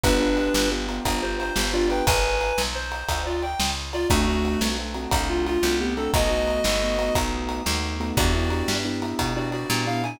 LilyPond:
<<
  \new Staff \with { instrumentName = "Clarinet" } { \time 12/8 \key d \major \tempo 4. = 118 <d' b'>2 r4. c''8 c''4 <f' d''>8 <b' g''>8 | <b' gis''>2 c''4. <f' d''>8 g''4 r8 <f' d''>8 | <a fis'>2 r4. f'8 f'4 <b g'>8 <c' a'>8 | <fis' dis''>2.~ <fis' dis''>8 r2 r8 |
<fis' d''>2 r4. <fis' d''>8 <fis' d''>4 f''8 gis''8 | }
  \new Staff \with { instrumentName = "Acoustic Grand Piano" } { \time 12/8 \key d \major <b d' f' g'>8 <b d' f' g'>8 <b d' f' g'>4 <b d' f' g'>8 <b d' f' g'>8 <b d' f' g'>8 <b d' f' g'>4 <b d' f' g'>8 <b d' f' g'>4 | r1. | <a c' d' fis'>8 <a c' d' fis'>4 <a c' d' fis'>8 <a c' d' fis'>8 <a c' d' fis'>8 <a c' d' fis'>4. <a c' d' fis'>4 <a c' d' fis'>8 | <a b dis' fis'>8 <a b dis' fis'>4 <a b dis' fis'>8 <a b dis' fis'>8 <a b dis' fis'>8 <a b dis' fis'>4. <a b dis' fis'>4 <a b dis' fis'>8 |
<b d' e' g'>8 <b d' e' g'>8 <b d' e' g'>8 <b d' e' g'>8 <b d' e' g'>8 <b d' e' g'>4 <b d' e' g'>4 <b d' e' g'>8 <b d' e' g'>8 <b d' e' g'>8 | }
  \new Staff \with { instrumentName = "Electric Bass (finger)" } { \clef bass \time 12/8 \key d \major g,,4. g,,4. g,,4. g,,4. | gis,,4. b,,4. d,4. cis,4. | d,4. b,,4. c,4. c,4. | b,,4. g,,4. b,,4. dis,4. |
e,4. g,4. b,4. ais,4. | }
  \new DrumStaff \with { instrumentName = "Drums" } \drummode { \time 12/8 <bd cymr>4 cymr8 sn4 cymr8 <bd cymr>4 cymr8 sn4 cymr8 | <bd cymr>4 cymr8 sn4 cymr8 <bd cymr>4 cymr8 sn4 cymr8 | <bd cymr>4 cymr8 sn4 cymr8 <bd cymr>4 cymr8 sn4 cymr8 | <bd cymr>4 cymr8 sn4 cymr8 <bd cymr>4 cymr8 sn4 cymr8 |
<bd cymr>4 cymr8 sn4 cymr8 <bd cymr>4 cymr8 sn4 cymr8 | }
>>